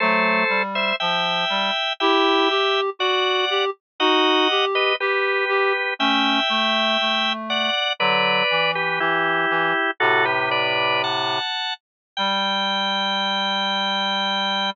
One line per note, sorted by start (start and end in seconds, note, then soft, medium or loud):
0.00 0.44 F#3 medium
0.00 0.44 A3 loud
0.00 0.62 A4 medium
0.00 0.62 C5 medium
0.49 0.92 G3 medium
0.75 0.96 C5 medium
0.75 0.96 E5 medium
1.00 1.45 F3 medium
1.00 1.93 E5 medium
1.00 1.93 G5 medium
1.50 1.71 G3 medium
2.00 2.48 E4 medium
2.00 2.48 G4 loud
2.00 2.81 E5 medium
2.00 2.81 G5 medium
2.50 2.90 G4 medium
2.99 3.45 F#4 medium
2.99 3.65 D5 medium
2.99 3.65 F#5 medium
3.50 3.70 G4 medium
4.00 4.48 D#4 medium
4.00 4.48 F#4 medium
4.00 4.65 D#5 medium
4.00 4.65 F#5 medium
4.50 4.93 G4 medium
4.75 4.96 B4 medium
4.75 4.96 D#5 medium
5.00 5.45 G4 medium
5.00 5.94 G4 medium
5.00 5.94 B4 medium
5.49 5.73 G4 medium
5.99 6.40 A3 medium
5.99 6.40 C#4 medium
5.99 7.33 E5 medium
5.99 7.33 G5 loud
6.49 6.97 A3 medium
7.01 7.70 A3 medium
7.50 7.93 D5 medium
7.50 7.93 F#5 medium
7.99 8.43 D3 medium
7.99 8.43 F#3 loud
7.99 8.71 B4 medium
7.99 8.71 D5 medium
8.50 8.99 E3 medium
8.75 8.99 G4 medium
8.75 8.99 B4 medium
9.00 9.46 E3 medium
9.00 9.91 E4 medium
9.00 9.91 G4 medium
9.50 9.73 E3 medium
10.00 11.39 A2 medium
10.00 11.39 C3 loud
10.00 10.25 F#4 medium
10.00 10.25 A4 loud
10.25 10.49 G4 medium
10.25 10.49 B4 medium
10.51 11.02 B4 medium
10.51 11.02 D5 medium
11.04 11.74 F#5 medium
11.04 11.74 A5 medium
12.17 14.71 G3 loud
12.17 14.70 G5 loud